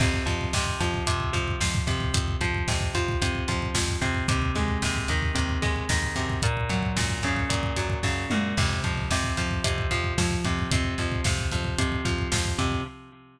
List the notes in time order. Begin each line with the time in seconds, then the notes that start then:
0.00 F2 C3, kick, crash
0.14 kick
0.26 F2 F3, kick, closed hi-hat
0.41 kick
0.53 F2 C3, kick, snare
0.66 kick
0.80 F2 F3, kick, closed hi-hat
0.94 kick
1.07 F2 C3, kick, closed hi-hat
1.20 kick
1.33 F2 F3, kick, closed hi-hat
1.48 kick
1.60 F2 F3, kick, snare
1.75 kick
1.87 F2 C3, kick, closed hi-hat
2.00 kick
2.14 F2, kick, closed hi-hat
2.28 kick
2.41 F2 F3, kick, closed hi-hat
2.54 kick
2.68 F2 C3, kick, snare
2.81 kick
2.95 F2 F3, kick, closed hi-hat
3.08 kick
3.22 F2 C3, kick, closed hi-hat
3.35 kick
3.48 F2 F3, kick, closed hi-hat
3.62 kick
3.74 F2 F3, kick, snare
3.89 kick
4.01 F2 C3, kick, closed hi-hat
4.14 kick
4.28 D#2 C3, kick, closed hi-hat
4.42 kick
4.55 D#2 G#3, kick, closed hi-hat
4.68 kick
4.82 D#2 C3, kick, snare
4.96 kick
5.08 D#2 D#3, kick, closed hi-hat
5.22 kick
5.35 D#2 C3, kick, closed hi-hat
5.49 kick
5.62 D#2 G#3, kick, closed hi-hat
5.76 kick
5.89 D#2 D#3, kick, snare
6.02 kick
6.16 F#2 C3, kick, closed hi-hat
6.30 kick
6.42 A#2, kick, closed hi-hat
6.57 kick
6.69 F#2 F#3, kick, closed hi-hat
6.83 kick
6.96 F#2 A#2, kick, snare
7.09 kick
7.23 F#2 C#3, kick, closed hi-hat
7.36 kick
7.49 F#2 A#2, kick, closed hi-hat
7.63 kick
7.76 F#2 F#3, kick, closed hi-hat
7.90 kick
8.03 F#2 C#3, kick, snare
8.30 F#2 A#2, mid tom
8.57 F2 C3, kick, crash
8.70 kick
8.84 F2 F3, kick, closed hi-hat
8.97 kick
9.10 F2 C3, kick, snare
9.24 kick
9.37 F2 F3, kick, closed hi-hat
9.51 kick
9.64 F2 C3, kick, closed hi-hat
9.78 kick
9.91 F2 F3, kick, closed hi-hat
10.04 kick
10.18 F2 F3, kick, snare
10.31 kick
10.44 F2 C3, kick, closed hi-hat
10.59 kick
10.71 F2 C3, kick, closed hi-hat
10.84 kick
10.98 F2 F3, kick, closed hi-hat
11.12 kick
11.24 F2 C3, kick, snare
11.39 kick
11.51 F2 F3, kick, closed hi-hat
11.64 kick
11.78 F2 C3, kick, closed hi-hat
11.92 kick
12.05 F2 F3, kick, closed hi-hat
12.18 kick
12.32 F2 F3, kick, snare
12.46 kick
12.58 F2 C3, kick, closed hi-hat
12.72 kick